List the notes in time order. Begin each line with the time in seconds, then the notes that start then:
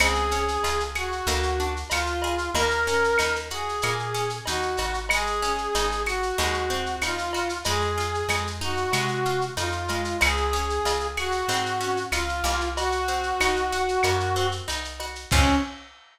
0.00 C#2 C4 G#4, cowbell, claves, shaker
0.15 shaker
0.31 C#4, shaker
0.48 shaker
0.63 C#2 F4, cowbell, shaker
0.80 shaker
0.95 F#4 G#4, claves, shaker
1.12 shaker
1.27 D2 A#3, cowbell, shaker
1.43 shaker
1.59 D4, shaker
1.76 shaker
1.90 D2 F4, cowbell, claves, shaker
2.06 shaker
2.22 G#4, cowbell, shaker
2.38 shaker
2.54 D#2 A#3 A#4, cowbell, shaker
2.70 shaker
2.87 C#4, shaker
3.04 shaker
3.18 D#2 D#4, cowbell, claves, shaker
3.36 shaker
3.50 F#4 G#4, shaker
3.69 shaker
3.82 A#2 A#3, cowbell, claves, shaker
3.99 shaker
4.14 C#4, shaker
4.30 shaker
4.45 D#2 D#4 F#4, cowbell, shaker
4.62 shaker
4.77 G#1 F#4, cowbell, shaker
4.94 shaker
5.09 G#3 G#4, cowbell, claves, shaker
5.26 shaker
5.42 C#4, shaker
5.58 shaker
5.75 G#1 D#4, cowbell, shaker
5.91 shaker
6.06 F#4, claves, shaker
6.22 shaker
6.38 D#2 G#3, cowbell, shaker
6.54 shaker
6.70 C4, shaker
6.86 shaker
7.02 D#2 D#4 F4, cowbell, claves, shaker
7.18 shaker
7.33 F#4, cowbell, shaker
7.49 shaker
7.64 F2 G#3 G#4, cowbell, shaker
7.81 shaker
7.98 F4, shaker
8.14 shaker
8.29 F2 G#3, cowbell, claves, shaker
8.47 shaker
8.61 D#4 F#4, shaker
8.77 shaker
8.92 C3 G#3, cowbell, claves, shaker
9.08 shaker
9.25 F4, shaker
9.41 shaker
9.57 F2 D#4 F4, cowbell, shaker
9.72 shaker
9.88 G#3, cowbell, shaker
10.05 shaker
10.21 C#2 C4 G#4, cowbell, claves, shaker
10.37 shaker
10.53 C#4, shaker
10.70 shaker
10.85 C#2 F4, cowbell, shaker
11.00 shaker
11.17 F#4 G#4, claves, shaker
11.32 shaker
11.48 G#2 C4, cowbell, shaker
11.66 shaker
11.81 C#4, shaker
11.97 shaker
12.12 C#2 F4, cowbell, claves, shaker
12.29 shaker
12.44 C2 A#3, cowbell, shaker
12.60 shaker
12.76 F#4, cowbell, shaker
12.92 shaker
13.07 C4, shaker
13.23 shaker
13.40 C2 D#4, cowbell, claves, shaker
13.56 shaker
13.72 F#4, shaker
13.88 shaker
14.03 F#2 A#3, cowbell, claves, shaker
14.20 shaker
14.36 C4, shaker
14.52 shaker
14.68 C2 D#4, cowbell, shaker
14.84 shaker
15.00 F#4, cowbell, shaker
15.15 shaker
15.31 C#2 C4 C#4 F4 G#4, kick, crash